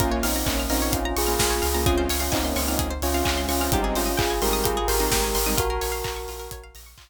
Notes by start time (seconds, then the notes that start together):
0.00 A#1 A#3 C#4 F4 A#4, kick, closed hi-hat
0.11 A#3 C#4 C#5
0.23 A#1 C4 D#4 F5, open hi-hat
0.36 A#5
0.46 A#1 A#3 C#4 C#6, kick, clap
0.59 F6
0.69 A#1 A#3 C4 C#4 D#4 F4 A#4, open hi-hat
0.82 C#5
0.92 A#1 C#4 F4 F5, kick, closed hi-hat
1.05 A#5
1.16 A#1 F4 G#4 C#6, open hi-hat
1.27 A#3 C#4 F4 F6
1.39 A#1 A#4, kick, snare
1.50 C#5
1.62 C#2 F5, open hi-hat
1.74 A#3 C#4 F4 A#5
1.86 G#3 C4 C#4 F4 G#4, kick, closed hi-hat
1.98 C5
2.09 C#2 C#5, open hi-hat
2.20 C#4 F4 F5
2.32 C#2 C4 D#4 G#5, kick, clap
2.43 A#3 C#4 C6
2.56 C#2 G#3 C4 C#4 F4 C#6, open hi-hat
2.68 C4 D#4 F6
2.79 C#2 G#4, kick, closed hi-hat
2.91 C5
3.02 C#2 C#4 F4 C#5, open hi-hat
3.14 G#3 C4 C#4 F4 F5
3.25 C#2 G#5, kick, clap
3.37 C6
3.49 C#2 C#4 F4 C#6, open hi-hat
3.61 G#3 C4 C#4 F4 F6
3.72 G#1 G3 G#3 C4 D#4 G4, kick, closed hi-hat
3.83 C4 D#4 G#4
3.95 G#1 C#4 F4 C5, open hi-hat
4.06 D#5
4.17 G#1 F4 G#4 G5, kick, clap
4.30 G#5
4.42 G#1 G3 G#3 C4 D#4 G4 A#4 C6, open hi-hat
4.53 D#6
4.64 G#1 F4 G4 G#4, kick, closed hi-hat
4.77 G#4
4.88 G#1 G4 A#4 C5, open hi-hat
5.00 G3 G#3 C4 D#4 D#5
5.11 G#1 G5, kick, snare
5.24 G#5
5.35 G#1 C6, open hi-hat
5.46 G3 G#3 C4 D#4 D#6
5.57 A#1 F4 F#4 A#4, kick, closed hi-hat
5.70 A#4
5.81 A#1 C#5, open hi-hat
5.92 F5
6.04 A#1 A#5, kick, clap
6.16 C#6
6.28 A#1 F4, open hi-hat
6.39 A#4
6.51 A#1 C#5, kick, closed hi-hat
6.63 F5
6.75 A#1 A#5, open hi-hat
6.86 C#6
6.97 A#1 F4, kick, clap